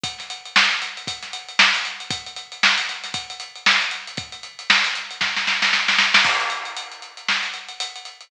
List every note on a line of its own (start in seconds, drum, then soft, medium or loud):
0.03 kick loud
0.03 closed hi-hat loud
0.18 snare soft
0.18 closed hi-hat medium
0.30 closed hi-hat loud
0.45 closed hi-hat medium
0.56 snare loud
0.71 closed hi-hat medium
0.82 snare soft
0.82 closed hi-hat loud
0.97 closed hi-hat medium
1.07 kick loud
1.07 closed hi-hat loud
1.23 snare medium
1.23 closed hi-hat medium
1.33 closed hi-hat loud
1.48 closed hi-hat medium
1.59 snare loud
1.74 closed hi-hat loud
1.85 closed hi-hat medium
2.00 closed hi-hat medium
2.10 kick loud
2.10 closed hi-hat loud
2.26 closed hi-hat medium
2.36 closed hi-hat loud
2.52 closed hi-hat medium
2.63 snare loud
2.78 closed hi-hat loud
2.89 snare soft
2.89 closed hi-hat medium
3.04 snare soft
3.04 closed hi-hat loud
3.14 kick loud
3.14 closed hi-hat loud
3.30 closed hi-hat medium
3.40 closed hi-hat loud
3.55 closed hi-hat medium
3.66 snare loud
3.81 closed hi-hat medium
3.91 closed hi-hat loud
4.07 closed hi-hat medium
4.17 kick loud
4.17 closed hi-hat loud
4.32 closed hi-hat medium
4.43 closed hi-hat medium
4.59 closed hi-hat loud
4.70 snare loud
4.84 closed hi-hat loud
4.95 closed hi-hat loud
5.11 closed hi-hat medium
5.21 kick medium
5.21 snare loud
5.36 snare medium
5.47 snare loud
5.62 snare loud
5.73 snare loud
5.88 snare loud
5.98 snare loud
6.14 snare loud
6.24 kick loud
6.24 crash loud
6.40 closed hi-hat medium
6.50 closed hi-hat loud
6.65 closed hi-hat medium
6.77 closed hi-hat loud
6.91 closed hi-hat medium
7.02 closed hi-hat medium
7.17 closed hi-hat medium
7.28 snare loud
7.43 snare soft
7.43 closed hi-hat medium
7.54 closed hi-hat medium
7.68 closed hi-hat medium
7.80 closed hi-hat loud
7.96 closed hi-hat medium
8.05 closed hi-hat medium
8.21 closed hi-hat medium